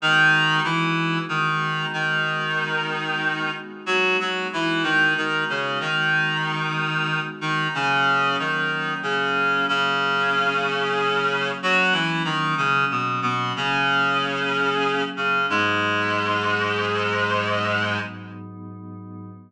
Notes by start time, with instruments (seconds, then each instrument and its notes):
0.01 clarinet D#3 D#4, pad 5 (bowed) G#3 B3 D#4 F#4
0.64 clarinet E3 E4
1.29 clarinet D#3 D#4
1.93 clarinet D#3 D#4
3.86 clarinet F#3 F#4
4.20 clarinet F#3 F#4
4.53 clarinet E3 E4
4.83 clarinet D#3 D#4
5.17 clarinet D#3 D#4
5.49 clarinet C#3 C#4
5.80 clarinet D#3 D#4
7.41 clarinet D#3 D#4
7.74 clarinet C#3 C#4, pad 5 (bowed) F#3 A#3 C#4
8.39 clarinet D#3 D#4
9.03 clarinet C#3 C#4
9.68 clarinet C#3 C#4
11.63 clarinet F#3 F#4
11.93 clarinet E3 E4
12.25 clarinet D#3 D#4
12.57 clarinet C#3 C#4
12.91 clarinet B2 B3
13.22 clarinet B2 B3
13.56 clarinet C#3 C#4
15.17 clarinet C#3 C#4
15.48 pad 5 (bowed) G#2 F#3 B3 D#4, clarinet G#2 G#3